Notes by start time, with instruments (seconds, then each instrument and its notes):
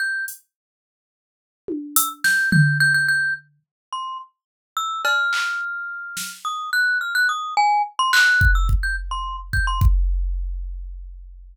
0.00 glockenspiel G6
0.28 closed hi-hat
1.68 high tom
1.96 glockenspiel E6, closed hi-hat
2.24 glockenspiel G6, snare
2.52 glockenspiel G6, floor tom
2.80 glockenspiel G6
2.94 glockenspiel G6
3.08 glockenspiel G6
3.93 glockenspiel C6
4.77 glockenspiel E6
5.05 glockenspiel F6, cowbell
5.33 clap
6.17 snare
6.45 glockenspiel D#6
6.73 glockenspiel F#6
7.01 glockenspiel F6
7.15 glockenspiel F#6
7.29 glockenspiel D#6
7.57 glockenspiel G#5
7.99 glockenspiel C6
8.13 glockenspiel F#6, clap
8.41 kick
8.55 glockenspiel E6
8.69 kick
8.83 glockenspiel G6
9.11 glockenspiel C6
9.53 glockenspiel G6, kick
9.67 glockenspiel C6
9.81 kick